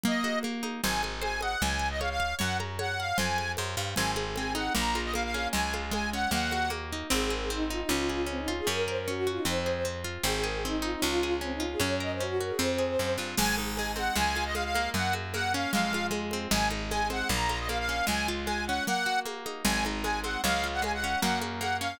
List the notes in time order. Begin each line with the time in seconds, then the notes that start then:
0.04 A#3 D#5, low conga
0.24 F#4, high conga
0.43 A#3, high conga
0.63 D#4, high conga
0.83 G#1 C5 G#5, low conga
1.03 G#5, high conga
1.22 C5 G#5, high conga
1.41 D#5 F#5, high conga
1.61 C#2 C#5 G#5, low conga
1.79 G#5
1.91 D#5
2.00 C#5 F5, high conga
2.10 F5
2.20 F5
2.39 F#2 C#5 F#5, low conga
2.60 A#5, high conga
2.79 C#5 F#5, high conga
2.99 F5 F#5
3.17 F2 C5 G#5, low conga
3.38 G#5, high conga
3.57 F#2 C5, high conga
3.77 G2 F5
3.95 G#1 C4 G#5, low conga
4.16 G#4, high conga
4.36 C4 G#5, high conga
4.55 D#4 F#5, high conga
4.75 A#1 A#3 A#5, low conga
4.95 F4, high conga
5.05 D#5
5.14 A#3 F5, high conga
5.24 F5
5.34 C#4, high conga
5.53 C#2 G#3 G#5, low conga
5.74 F4, high conga
5.91 G#3 G#5, high conga
6.13 C#4 F#5
6.31 D#2 A#3 F#5, low conga
6.51 F#4, high conga
6.70 A#3, high conga
6.92 D#4
7.10 G#1 C4 G#4
7.30 G#4 A#4
7.41 G#4
7.50 C4 D#4
7.70 D#4 F4
7.80 D#4
7.89 C#2 C#4 F4
8.09 G#4
8.26 C4 C#4
8.38 D#4
8.48 F4
8.57 G#4
8.67 F#2 C#4 A#4
8.87 A#4 C5
8.96 A#4
9.08 C#4 F#4
9.27 F4 F#4
9.37 D#4
9.45 F2 C4 C5
9.66 G#4
9.85 C4
10.04 F4
10.24 G#1 C4 G#4
10.43 G#4 A#4
10.54 G#4
10.64 C4 D#4
10.82 D#4 F4
10.92 D#4
11.01 C#2 C#4 F4
11.23 G#4
11.41 C4 C#4
11.52 D#4
11.60 F4
11.71 G#4
11.80 F#2 C#4 C#5
12.00 A#4 D#5
12.12 C5
12.20 C#4 F#4
12.39 F#4 A#4
12.50 G#4
12.59 F2 C4 C5
12.78 G#4
12.99 F#2 C4
13.18 G2 F4
13.38 G#1 G#3 G#5, crash, low conga
13.58 D#4, high conga
13.76 G#3 G#5, high conga
13.96 C4 F#5, high conga
14.16 C#2 G#3 G#5, low conga
14.36 F4, high conga
14.46 D#5
14.55 G#3 F5, high conga
14.64 F5
14.75 A#3, high conga
14.94 F#2 F#5, low conga
15.13 F#4, high conga
15.34 A#3 F#5, high conga
15.54 C#4 F5
15.72 F2 G#3 F5, low conga
15.93 F4, high conga
16.11 G#3, high conga
16.31 C4, high conga
16.51 G#1 G#3 G#5, low conga
16.71 D#4, high conga
16.90 G#3 G#5, high conga
17.10 C4 F#5, high conga
17.29 A#1 A#3 A#5, low conga
17.49 F4, high conga
17.59 D#5
17.69 A#3 F5, high conga
17.79 F5
17.89 C#4
18.07 C#2 G#3 G#5, low conga
18.28 F4
18.46 G#3 G#5, high conga
18.67 C#4 F#5
18.87 A#3 F#5, low conga
19.06 F#4
19.25 A#3, high conga
19.46 D#4, high conga
19.65 G#1 G#3 G#5, low conga
19.85 D#4, high conga
20.03 G#3 G#5, high conga
20.24 C4 F#5, high conga
20.43 C#2 G#3 F5, low conga
20.64 F4
20.73 F#5
20.82 G#3 G#5, high conga
20.93 F#5
21.04 C#4
21.21 F#2 A#3 F#5, low conga
21.41 F#4, high conga
21.60 A#3 F#5, high conga
21.81 C#4 F5